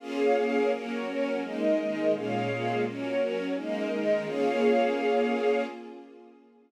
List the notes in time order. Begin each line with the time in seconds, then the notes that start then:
0.00 A#3 C#4 F4 G#4 C#5 F5
0.36 A#3 C#4 G#4 A#4
0.71 F#3 A#3 C#4 F#4 A#4 C#5
1.06 F#3 C#4 F#4
1.42 G#3 A#3 D#4 A#4 D#5
1.78 D#3 G#3 D#4
2.13 A#2 G#3 A#3 C#4 F4 G#4 C#5 F5
2.49 A#2 G#3 A#3 F4
2.84 F#3 A#3 C#4 F#4 A#4 C#5
3.19 F#3 C#4 F#4
3.54 G#3 A#3 D#4 A#4 D#5
3.91 D#3 G#3 D#4
4.26 A#3 C#4 F4 G#4 C#5 F5